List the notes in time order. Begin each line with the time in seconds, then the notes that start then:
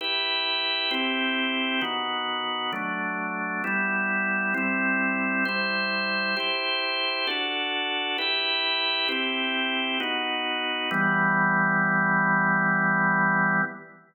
0.01 E4 G4 B4
0.91 C4 E4 G4
1.81 D#3 B3 F#4
2.73 F#3 A3 D4
3.64 G3 B3 E4
4.54 G3 C4 E4
5.45 G3 E4 C5
6.37 E4 G4 C5
7.27 D4 F#4 A4
8.18 E4 G4 B4
9.09 C4 E4 G4
10.00 B3 D#4 F#4
10.91 E3 G3 B3